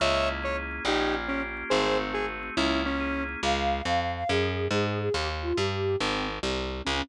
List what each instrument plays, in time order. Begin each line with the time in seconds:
0.00 electric bass (finger) C#2, drawbar organ A#3, lead 1 (square) C#5 E5
0.14 drawbar organ C#4
0.29 drawbar organ E4
0.43 drawbar organ G#4, lead 1 (square) C#5
0.57 drawbar organ A#3
0.71 drawbar organ C#4
0.85 electric bass (finger) A#1, drawbar organ A#3, lead 1 (square) D#4 G4
1.00 drawbar organ C#4
1.14 drawbar organ F4
1.28 lead 1 (square) C#4, drawbar organ G4
1.43 drawbar organ A#3
1.57 drawbar organ C#4
1.70 electric bass (finger) G#1, drawbar organ A3, lead 1 (square) G#4 C5
1.85 drawbar organ C4
2.00 drawbar organ F#4
2.14 lead 1 (square) G#4, drawbar organ G#4
2.29 drawbar organ A3
2.43 drawbar organ C4
2.57 electric bass (finger) C#2, drawbar organ A#3, lead 1 (square) C#4 E4
2.71 drawbar organ C#4
2.85 lead 1 (square) C#4, drawbar organ E4
3.00 drawbar organ G#4
3.14 drawbar organ A#3
3.29 drawbar organ C#4
3.43 electric bass (finger) C#2, flute F5
3.85 electric bass (finger) F2, flute F5
4.00 flute F5
4.16 flute F5
4.29 electric bass (finger) F#2, flute G#4
4.71 electric bass (finger) G#2, flute G#4
4.86 flute G#4
5.00 flute G#4
5.14 electric bass (finger) D#2, flute G4
5.42 flute F4
5.56 electric bass (finger) G2, flute G4
6.00 electric bass (finger) G#1, flute C4
6.43 electric bass (finger) C2
6.85 electric bass (finger) C#2, flute C#4